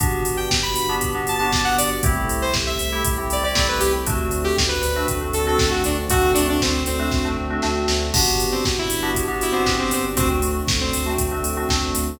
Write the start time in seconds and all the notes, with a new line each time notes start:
0.00 G1 B3 D4 F#4 G4, kick, closed hi-hat
0.24 G1, open hi-hat
0.37 G5
0.51 G1, kick, snare
0.63 B5
0.76 G1, open hi-hat
0.89 B3 D4 F#4 G4
1.01 G1, kick, closed hi-hat
1.15 B3 D4 F#4 G4
1.27 G1 A5, open hi-hat
1.38 B3 D4 F#4 G4 A5
1.52 G1 B3 D4 F#4 G4, kick, snare
1.65 F#5
1.78 G1 D5, open hi-hat
2.03 C2 A3 C4 E4 G4, kick, closed hi-hat
2.29 C2, open hi-hat
2.42 C5
2.54 C2, kick, snare
2.67 E5
2.79 C2, open hi-hat
2.92 A3 C4 E4 G4
3.05 C2, kick, closed hi-hat
3.18 A3 C4 E4 G4
3.30 C2 D5, open hi-hat
3.43 A3 C4 E4 G4 D5
3.55 C2 A3 C4 E4 G4, kick, snare
3.69 B4
3.80 C2 G4, open hi-hat
4.07 D2 A3 C4 D4 F#4, kick, closed hi-hat
4.31 D2, open hi-hat
4.44 G4
4.57 D2, kick, snare
4.69 B4
4.83 D2, open hi-hat
4.96 A3 C4 D4 F#4
5.08 D2, kick, closed hi-hat
5.21 A3 C4 D4 F#4
5.33 D2 A4, open hi-hat
5.47 A3 C4 D4 F#4 A4
5.59 D2 A3 C4 D4 F#4, kick, snare
5.71 F#4
5.84 D2 D4, open hi-hat
6.09 D2 A3 C4 D4 F#4, kick, closed hi-hat
6.34 D2 D4, open hi-hat
6.49 D4
6.60 D2 C4, kick, snare
6.86 D2 C4, open hi-hat
6.99 A3 C4 D4 F#4
7.12 D2, kick, snare
7.25 A3 C4 D4 F#4
7.37 D2
7.50 A3 C4 D4 F#4
7.62 D2 A3 C4 D4 F#4, snare
7.88 D2, snare
8.14 G1 B3 D4 F#4 G4, kick, crash
8.39 G1, open hi-hat
8.52 C4
8.65 G1, kick, snare
8.79 E4
8.90 G1, open hi-hat
9.03 B3 D4 F#4 G4
9.14 G1, kick, closed hi-hat
9.28 B3 D4 F#4 G4
9.41 G1 E4, open hi-hat
9.52 B3 C4 D4 F#4 G4
9.66 G1 B3 D4 F#4 G4, kick, snare
9.79 C4
9.91 G1 C4, open hi-hat
10.16 D2 A3 C4 D4 F#4, kick, closed hi-hat
10.41 D2, open hi-hat
10.67 D2, kick, snare
10.81 C4
10.93 D2, open hi-hat
11.06 A3 C4 D4 F#4
11.18 D2, kick, closed hi-hat
11.31 A3 C4 D4 F#4
11.43 D2, open hi-hat
11.57 A3 C4 D4 F#4
11.69 D2 A3 C4 D4 F#4, kick, snare
11.95 D2, open hi-hat